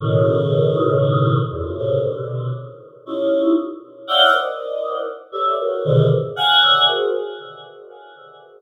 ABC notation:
X:1
M:7/8
L:1/16
Q:1/4=59
K:none
V:1 name="Choir Aahs"
[A,,B,,^C,^D,]6 [E,,F,,^F,,] [F,,^G,,A,,^A,,=C,^C,] [B,,=C,=D,]2 z2 [^C^DE=F=G]2 | z2 [^cdef^fg] [^A=cd^d]3 z [G=AB^c=de] [^F^G^ABc] [^G,,^A,,B,,=C,D,^D,] z [=f^f^g] [^c=defg] [FGA=c] |]